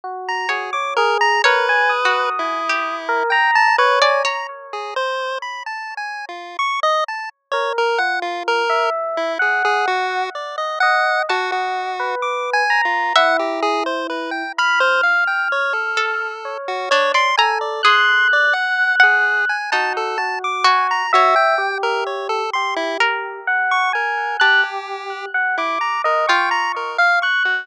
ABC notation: X:1
M:7/8
L:1/16
Q:1/4=64
K:none
V:1 name="Lead 1 (square)"
z _b _A d' _B b | B4 E4 g a B _a _b z | _A c2 b (3=a2 _a2 F2 _d' _e =a z _d _B | _g F _B2 z E _A A _G2 d _e g2 |
_G G3 (3d'2 _a2 F2 _g =G _A c B =g | b c f g _d A4 _G d c' _a =d | c'2 d _g2 _A2 _a =a =A a d' _a _b | _G =g2 _B _d A c' E z3 _d' B2 |
G4 z E _b _B g b B f _d' _G |]
V:2 name="Electric Piano 1"
_G2 G _d _A2 | _B _a _e'5 B _b2 _d2 z2 | z12 _B2 | F3 e3 _g4 z2 _e2 |
_g3 B3 _b2 E6 | f'8 _d4 A2 | _g'8 _G2 G4 | e2 G4 G4 _g2 _a2 |
_g' =G3 _g d'2 _e _d'3 f g'2 |]
V:3 name="Orchestral Harp"
z2 _d2 z2 | (3_d4 _G4 =G4 z3 =d _d2 | z14 | z14 |
a6 z2 e6 | b6 A2 z2 D d _b2 | _A4 z _g2 z _E4 _G2 | _d8 _B6 |
a8 F6 |]